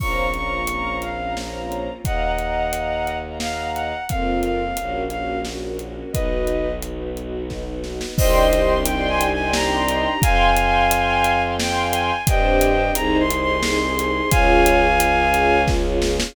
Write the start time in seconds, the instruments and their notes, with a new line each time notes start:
0.00 violin A#1 C#6, string ensemble 1 A#3 C4 C#4 F4 C5 C#5 F5 A#5, kick, crash
0.34 string ensemble 1 C5 C#5 F5 A#5, violin C#6, closed hi-hat
0.67 string ensemble 1 C5 C#5 F5 A#5, closed hi-hat
1.02 violin F5, closed hi-hat
1.19 string ensemble 1 C5 C#5 F5 A#5
1.36 string ensemble 1 C5 C#5 F5 A#5, snare
1.72 closed hi-hat
2.04 violin D#2 D#5 F#5, string ensemble 1 D#5 F5 F#5 A#5, kick, closed hi-hat
2.38 string ensemble 1 D#5 F5 F#5 A#5, closed hi-hat
2.73 string ensemble 1 D#5 F5 F#5 A#5, closed hi-hat
3.07 closed hi-hat
3.24 string ensemble 1 D#5 F5 F#5 A#5
3.40 string ensemble 1 D#5 F5 F#5 A#5, violin F5, snare
3.74 violin F#5, closed hi-hat
4.09 violin F2 F5, string ensemble 1 A#3 C4 F4 A#4, kick, closed hi-hat
4.43 violin F5, closed hi-hat
4.77 violin A#1, string ensemble 1 A#3 C#4 F#4 A#4, closed hi-hat
5.10 string ensemble 1 C#4 F#4 A#4, violin F5, closed hi-hat
5.45 string ensemble 1 C#4 F#4 A#4, snare
5.62 string ensemble 1 C#4 F#4 A#4
5.79 string ensemble 1 C#4 F#4 A#4, closed hi-hat
5.97 string ensemble 1 C#4 F#4 A#4
6.12 violin B1 B4 D#5, string ensemble 1 B3 D#4 F#4 B4, kick, closed hi-hat
6.47 closed hi-hat
6.82 string ensemble 1 D#4 F#4 B4, closed hi-hat
7.16 string ensemble 1 D#4 F#4 B4, closed hi-hat
7.50 string ensemble 1 D#4 F#4 B4, kick, snare
7.67 string ensemble 1 D#4 F#4 B4
7.84 string ensemble 1 D#4 F#4 B4, snare
8.01 string ensemble 1 D#4 F#4 B4, snare
8.18 violin C2 C5 D#5, string ensemble 1 C4 D4 D#4 G4 D5 D#5 G5 C6, kick, crash
8.52 string ensemble 1 D5 D#5 G5 C6, closed hi-hat
8.85 string ensemble 1 D5 D#5 G5 C6, violin G5, closed hi-hat
9.09 violin G#5
9.21 closed hi-hat
9.33 violin G#5
9.38 string ensemble 1 D5 D#5 G5 C6
9.53 string ensemble 1 D5 D#5 G5 C6, violin A#5, snare
9.88 closed hi-hat
10.22 violin F2 F5 G#5, string ensemble 1 F5 G5 G#5 C6, kick, closed hi-hat
10.57 string ensemble 1 F5 G5 G#5 C6, closed hi-hat
10.91 string ensemble 1 F5 G5 G#5 C6, closed hi-hat
11.24 closed hi-hat
11.42 string ensemble 1 F5 G5 G#5 C6
11.59 string ensemble 1 F5 G5 G#5 C6, violin G5, snare
11.93 violin G#5, closed hi-hat
12.27 violin G2 D#5 G5, string ensemble 1 C4 D4 G4 C5, kick, closed hi-hat
12.61 closed hi-hat
12.95 violin C2 A#5, string ensemble 1 C4 D#4 G#4 C5, closed hi-hat
13.20 violin C6
13.30 string ensemble 1 D#4 G#4 C5, closed hi-hat
13.41 violin C6
13.63 string ensemble 1 D#4 G#4 C5, violin C6, snare
13.81 string ensemble 1 D#4 G#4 C5
13.98 string ensemble 1 D#4 G#4 C5, closed hi-hat
14.15 string ensemble 1 D#4 G#4 C5
14.31 violin C#2 F5 G#5, string ensemble 1 C#4 F4 G#4 C#5, kick, closed hi-hat
14.66 closed hi-hat
15.00 string ensemble 1 F4 G#4 C#5, closed hi-hat
15.34 string ensemble 1 F4 G#4 C#5, closed hi-hat
15.68 string ensemble 1 F4 G#4 C#5, kick, snare
15.85 string ensemble 1 F4 G#4 C#5
16.02 string ensemble 1 F4 G#4 C#5, snare
16.20 string ensemble 1 F4 G#4 C#5, snare